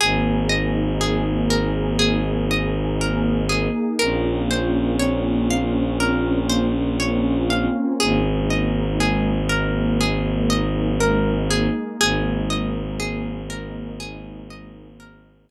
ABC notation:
X:1
M:4/4
L:1/8
Q:1/4=60
K:Ab
V:1 name="Orchestral Harp"
A e A B A e B A | B c d f B c d f | A e A B A e B A | A e A B A e B A |]
V:2 name="Violin" clef=bass
A,,,8 | B,,,8 | A,,,8 | A,,,8 |]
V:3 name="Pad 2 (warm)"
[B,EA]8 | [B,CDF]8 | [A,B,E]8 | [A,B,E]8 |]